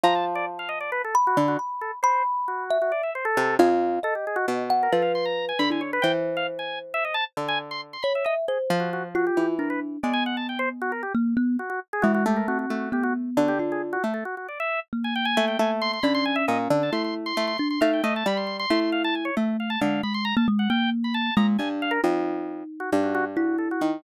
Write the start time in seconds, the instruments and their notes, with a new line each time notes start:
0.04 harpsichord F3, kalimba A5, drawbar organ A#5
0.15 drawbar organ A5
0.35 drawbar organ D5
0.59 drawbar organ F5
0.69 drawbar organ D#5
0.81 drawbar organ D5
0.92 drawbar organ B4
1.04 drawbar organ A4
1.15 kalimba B5
1.27 drawbar organ F#4
1.37 harpsichord D3
1.48 drawbar organ F#4
1.59 kalimba B5
1.81 drawbar organ A4
2.03 drawbar organ C5, kalimba B5
2.48 drawbar organ F#4
2.70 kalimba E5
2.82 drawbar organ F#4
2.92 drawbar organ D5
3.03 drawbar organ E5
3.15 drawbar organ C5
3.25 drawbar organ A4
3.37 harpsichord C3
3.59 harpsichord F2, drawbar organ G#4, kalimba F5
4.03 drawbar organ A4, kalimba D#5
4.15 drawbar organ G4
4.27 drawbar organ G#4
4.36 drawbar organ F#4
4.48 harpsichord B2
4.70 kalimba F#5
4.83 drawbar organ A#4
4.92 harpsichord F3, drawbar organ A4, kalimba B4
5.02 drawbar organ F5
5.15 drawbar organ C6
5.25 drawbar organ A#5
5.49 drawbar organ G#5
5.59 harpsichord D3, drawbar organ B5
5.70 kalimba E4, drawbar organ G#5
5.81 drawbar organ C#5
5.93 drawbar organ B4
6.02 harpsichord E3, kalimba C5, drawbar organ G5
6.37 drawbar organ F5
6.59 drawbar organ G#5
6.94 drawbar organ E5
7.05 drawbar organ D#5
7.14 drawbar organ A5
7.37 harpsichord D3
7.48 drawbar organ G#5
7.71 drawbar organ C6
7.93 drawbar organ C6
8.03 kalimba C#5, drawbar organ B5
8.15 drawbar organ E5
8.25 drawbar organ D#5, kalimba E5
8.48 drawbar organ G#4, kalimba C5
8.70 harpsichord F3
8.80 drawbar organ F#4
8.93 drawbar organ F#4
9.15 kalimba F4, drawbar organ F#4
9.27 drawbar organ G4
9.37 harpsichord E3
9.59 kalimba D4, drawbar organ A#4
9.70 drawbar organ B4
10.03 harpsichord G#3, kalimba B3, drawbar organ D5
10.13 drawbar organ G#5
10.26 drawbar organ F#5
10.37 drawbar organ A5
10.49 drawbar organ G5
10.59 drawbar organ C5
10.82 drawbar organ F#4
10.92 drawbar organ A#4
11.03 drawbar organ G4
11.15 kalimba A#3
11.37 kalimba B3
11.59 drawbar organ F#4
11.70 drawbar organ F#4
11.93 drawbar organ G#4
12.02 harpsichord E3, kalimba G#3, drawbar organ F#4
12.14 drawbar organ F#4
12.26 harpsichord A3, drawbar organ G4
12.36 drawbar organ A#4
12.48 kalimba C4, drawbar organ F#4
12.59 drawbar organ F#4
12.70 harpsichord A3
12.92 kalimba B3, drawbar organ G4
13.03 drawbar organ F#4
13.37 harpsichord D3, drawbar organ F#4
13.48 drawbar organ G4
13.59 kalimba F4
13.72 drawbar organ G#4
13.93 drawbar organ F#4
14.04 harpsichord A3
14.14 drawbar organ A4
14.25 drawbar organ F#4
14.37 drawbar organ F#4
14.49 drawbar organ D5
14.60 drawbar organ E5
14.93 kalimba A#3
15.04 drawbar organ G#5
15.16 drawbar organ G5
15.25 drawbar organ G#5
15.37 harpsichord A3
15.48 drawbar organ G5
15.59 harpsichord A3, drawbar organ G#5
15.82 drawbar organ C6
15.93 drawbar organ C6
16.03 harpsichord D3, kalimba C#4, drawbar organ B5
16.15 drawbar organ C6
16.25 drawbar organ G#5
16.36 drawbar organ E5
16.48 harpsichord A#2, drawbar organ D#5
16.70 harpsichord D3
16.83 drawbar organ A5
16.92 harpsichord A3, kalimba E4, drawbar organ C6
17.04 drawbar organ C6
17.26 drawbar organ C6
17.37 harpsichord A3
17.47 drawbar organ C6
17.58 kalimba D4, drawbar organ C6
17.70 drawbar organ C6
17.81 harpsichord A3, kalimba D#4, drawbar organ F5
17.93 drawbar organ G5
18.04 harpsichord A3, drawbar organ D#5
18.16 drawbar organ A5
18.26 harpsichord G3, drawbar organ B5
18.37 drawbar organ C6
18.47 drawbar organ C6
18.59 drawbar organ C6
18.70 harpsichord A3, kalimba E4
18.80 drawbar organ C6
18.92 drawbar organ F5
19.04 drawbar organ A5
19.15 drawbar organ G#5
19.25 drawbar organ C#5
19.37 harpsichord A3, kalimba A3
19.60 drawbar organ F5
19.70 drawbar organ A5
19.81 harpsichord D3, kalimba G#3, drawbar organ F5
20.03 kalimba G#3, drawbar organ B5
20.14 drawbar organ C6
20.25 drawbar organ A#5
20.37 kalimba A#3, drawbar organ A5
20.48 kalimba G#3
20.59 drawbar organ F#5
20.70 kalimba A#3, drawbar organ G5
21.04 drawbar organ B5
21.14 drawbar organ A5
21.37 harpsichord A#2, kalimba G#3, drawbar organ A#5
21.59 harpsichord G2, kalimba D4, drawbar organ G#5
21.82 drawbar organ F5
21.91 drawbar organ A#4
22.04 harpsichord F2, kalimba D#4
22.80 drawbar organ F#4
22.92 harpsichord G2
23.03 drawbar organ F#4
23.15 drawbar organ F#4
23.36 kalimba E4, drawbar organ F#4
23.58 drawbar organ A4
23.71 drawbar organ F#4
23.81 harpsichord D#3